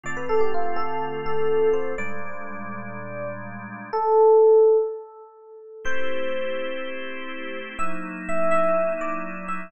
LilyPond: <<
  \new Staff \with { instrumentName = "Electric Piano 1" } { \time 4/4 \key a \minor \tempo 4 = 124 d''16 b'16 a'16 g'16 f'8 a'4 a'4 c''8 | d''1 | a'2 r2 | c''1 |
e''16 r8. e''8 e''4 d''4 e''8 | }
  \new Staff \with { instrumentName = "Drawbar Organ" } { \time 4/4 \key a \minor <d a c' f'>1 | <bes, g aes d'>1 | r1 | <a c' e' g'>1 |
<fis ais dis' e'>1 | }
>>